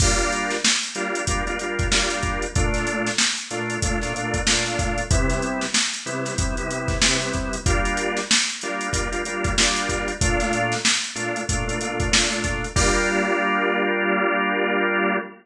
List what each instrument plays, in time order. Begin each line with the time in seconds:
0.00 drawbar organ G3 A#3 D4 F4, kick, crash
0.18 closed hi-hat
0.32 closed hi-hat
0.50 snare, closed hi-hat
0.64 snare
0.83 closed hi-hat
0.95 drawbar organ G3 A#3 D4 F4, closed hi-hat
1.15 closed hi-hat
1.27 drawbar organ G3 A#3 D4 F4, kick, closed hi-hat
1.47 drawbar organ G3 A#3 D4 F4, closed hi-hat
1.59 drawbar organ G3 A#3 D4 F4, closed hi-hat
1.79 kick, closed hi-hat
1.91 drawbar organ G3 A#3 D4 F4, snare
2.10 closed hi-hat
2.23 kick, closed hi-hat
2.42 closed hi-hat
2.55 drawbar organ A#2 A3 D4 F4, kick, closed hi-hat
2.74 snare, closed hi-hat
2.87 closed hi-hat
3.07 snare, closed hi-hat
3.18 snare
3.37 closed hi-hat
3.51 drawbar organ A#2 A3 D4 F4, closed hi-hat
3.70 closed hi-hat
3.82 drawbar organ A#2 A3 D4 F4, kick, closed hi-hat
4.01 drawbar organ A#2 A3 D4 F4, snare, closed hi-hat
4.14 drawbar organ A#2 A3 D4 F4, closed hi-hat
4.34 kick, closed hi-hat
4.47 drawbar organ A#2 A3 D4 F4, snare
4.66 snare, closed hi-hat
4.79 kick, closed hi-hat
4.98 closed hi-hat
5.11 drawbar organ C3 G3 B3 E4, kick, closed hi-hat
5.30 snare, closed hi-hat
5.42 closed hi-hat
5.61 snare, closed hi-hat
5.74 snare
5.93 snare, closed hi-hat
6.06 drawbar organ C3 G3 B3 E4, closed hi-hat
6.25 snare, closed hi-hat
6.38 drawbar organ C3 G3 B3 E4, kick, closed hi-hat
6.57 drawbar organ C3 G3 B3 E4, closed hi-hat
6.69 drawbar organ C3 G3 B3 E4, closed hi-hat
6.88 kick, snare, closed hi-hat
7.02 drawbar organ C3 G3 B3 E4, snare
7.22 closed hi-hat
7.34 kick, closed hi-hat
7.53 closed hi-hat
7.66 drawbar organ G3 A#3 D4 F4, kick, closed hi-hat
7.85 closed hi-hat
7.97 closed hi-hat
8.17 snare, closed hi-hat
8.31 snare
8.49 closed hi-hat
8.61 drawbar organ G3 A#3 D4 F4, closed hi-hat
8.81 closed hi-hat
8.93 drawbar organ G3 A#3 D4 F4, kick, closed hi-hat
9.12 drawbar organ G3 A#3 D4 F4, closed hi-hat
9.25 drawbar organ G3 A#3 D4 F4, closed hi-hat
9.44 kick, closed hi-hat
9.58 drawbar organ G3 A#3 D4 F4, snare
9.76 closed hi-hat
9.89 kick, closed hi-hat
10.08 closed hi-hat
10.21 drawbar organ A#2 A3 D4 F4, kick, closed hi-hat
10.40 snare, closed hi-hat
10.53 closed hi-hat
10.72 snare, closed hi-hat
10.85 snare
11.04 closed hi-hat
11.15 drawbar organ A#2 A3 D4 F4, closed hi-hat
11.36 closed hi-hat
11.49 drawbar organ A#2 A3 D4 F4, kick, closed hi-hat
11.67 drawbar organ A#2 A3 D4 F4, closed hi-hat
11.81 drawbar organ A#2 A3 D4 F4, closed hi-hat
12.00 kick, closed hi-hat
12.11 drawbar organ A#2 A3 D4 F4, snare
12.32 closed hi-hat
12.44 kick, closed hi-hat
12.64 closed hi-hat
12.76 drawbar organ G3 A#3 D4 F4, kick, crash